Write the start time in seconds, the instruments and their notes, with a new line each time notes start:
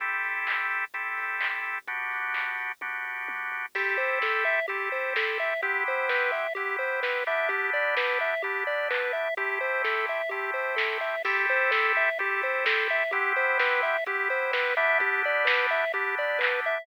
0.00 synth bass 2 A1, drawbar organ C4 E4 G4 A4, kick, closed hi-hat
0.23 synth bass 2 A1, open hi-hat
0.35 synth bass 2 A1
0.47 synth bass 2 A1, kick, clap
0.70 open hi-hat
0.94 drawbar organ C4 E4 G4 A4, kick, closed hi-hat
1.17 synth bass 2 A2, open hi-hat
1.41 kick, clap
1.52 synth bass 2 A1
1.64 open hi-hat
1.76 synth bass 2 A1
1.87 synth bass 2 G1, drawbar organ B3 D4 F#4 G4, kick, closed hi-hat
2.11 synth bass 2 G1, open hi-hat
2.24 synth bass 2 G1
2.34 synth bass 2 G1, kick, clap
2.58 open hi-hat
2.81 drawbar organ B3 D4 F#4 G4, kick, high tom
3.05 synth bass 2 G1, floor tom
3.28 synth bass 2 G1, high tom
3.52 synth bass 2 G#1, floor tom
3.75 synth bass 2 A1, drawbar organ C4 E4 G4 A4, lead 1 (square) G4, kick, crash
3.97 synth bass 2 A1, lead 1 (square) C5, open hi-hat
4.09 synth bass 2 E2
4.22 synth bass 2 A1, lead 1 (square) A4, kick, snare
4.45 lead 1 (square) E5, open hi-hat
4.68 drawbar organ C4 E4 G4 A4, lead 1 (square) G4, kick, closed hi-hat
4.91 synth bass 2 E2, lead 1 (square) C5, open hi-hat
5.16 lead 1 (square) A4, kick, snare
5.29 synth bass 2 A1
5.39 lead 1 (square) E5, open hi-hat
5.50 synth bass 2 A1
5.62 synth bass 2 G1, drawbar organ B3 C4 E4 G4, lead 1 (square) G4, kick, closed hi-hat
5.86 synth bass 2 G1, lead 1 (square) C5, open hi-hat
5.98 synth bass 2 G1
6.08 synth bass 2 G1, lead 1 (square) B4, kick, snare
6.32 lead 1 (square) E5, open hi-hat
6.55 drawbar organ B3 C4 E4 G4, lead 1 (square) G4, kick, closed hi-hat
6.79 synth bass 2 G1, lead 1 (square) C5, open hi-hat
7.03 lead 1 (square) B4, kick, snare
7.15 synth bass 2 G1
7.26 drawbar organ B3 D4 E4 G4, lead 1 (square) E5, open hi-hat
7.38 synth bass 2 G1
7.49 synth bass 2 G1, lead 1 (square) G4, kick, closed hi-hat
7.73 synth bass 2 G1, lead 1 (square) D5, open hi-hat
7.85 synth bass 2 G1
7.97 synth bass 2 G1, lead 1 (square) B4, kick, snare
8.20 lead 1 (square) E5, open hi-hat
8.42 drawbar organ B3 D4 E4 G4, lead 1 (square) G4, kick, closed hi-hat
8.66 synth bass 2 G1, lead 1 (square) D5, open hi-hat
8.90 lead 1 (square) B4, kick, clap
9.01 synth bass 2 G1
9.13 lead 1 (square) E5, open hi-hat
9.27 synth bass 2 G1
9.37 synth bass 2 A1, drawbar organ A3 C4 E4 G4, lead 1 (square) G4, kick, closed hi-hat
9.61 synth bass 2 A1, lead 1 (square) C5, open hi-hat
9.72 synth bass 2 E2
9.84 synth bass 2 A1, lead 1 (square) A4, kick, snare
10.08 lead 1 (square) E5, open hi-hat
10.29 drawbar organ A3 C4 E4 G4, lead 1 (square) G4, kick, closed hi-hat
10.54 synth bass 2 A1, lead 1 (square) C5, open hi-hat
10.76 lead 1 (square) A4, kick, snare
10.90 synth bass 2 A1
11.01 lead 1 (square) E5, open hi-hat
11.15 synth bass 2 E2
11.24 synth bass 2 A1, drawbar organ C4 E4 G4 A4, lead 1 (square) G4, kick, crash
11.48 synth bass 2 A1, lead 1 (square) C5, open hi-hat
11.59 synth bass 2 E2
11.71 synth bass 2 A1, lead 1 (square) A4, kick, snare
11.95 lead 1 (square) E5, open hi-hat
12.19 drawbar organ C4 E4 G4 A4, lead 1 (square) G4, kick, closed hi-hat
12.42 synth bass 2 E2, lead 1 (square) C5, open hi-hat
12.66 lead 1 (square) A4, kick, snare
12.78 synth bass 2 A1
12.89 lead 1 (square) E5, open hi-hat
13.00 synth bass 2 A1
13.11 synth bass 2 G1, drawbar organ B3 C4 E4 G4, lead 1 (square) G4, kick, closed hi-hat
13.36 synth bass 2 G1, lead 1 (square) C5, open hi-hat
13.48 synth bass 2 G1
13.59 synth bass 2 G1, lead 1 (square) B4, kick, snare
13.83 lead 1 (square) E5, open hi-hat
14.06 drawbar organ B3 C4 E4 G4, lead 1 (square) G4, kick, closed hi-hat
14.30 synth bass 2 G1, lead 1 (square) C5, open hi-hat
14.53 lead 1 (square) B4, kick, snare
14.65 synth bass 2 G1
14.77 drawbar organ B3 D4 E4 G4, lead 1 (square) E5, open hi-hat
14.90 synth bass 2 G1
14.99 synth bass 2 G1, lead 1 (square) G4, kick, closed hi-hat
15.23 synth bass 2 G1, lead 1 (square) D5, open hi-hat
15.35 synth bass 2 G1
15.45 synth bass 2 G1, lead 1 (square) B4, kick, snare
15.70 lead 1 (square) E5, open hi-hat
15.94 drawbar organ B3 D4 E4 G4, lead 1 (square) G4, kick, closed hi-hat
16.17 synth bass 2 G1, lead 1 (square) D5, open hi-hat
16.39 lead 1 (square) B4, kick, clap
16.52 synth bass 2 G1
16.64 lead 1 (square) E5, open hi-hat
16.77 synth bass 2 G1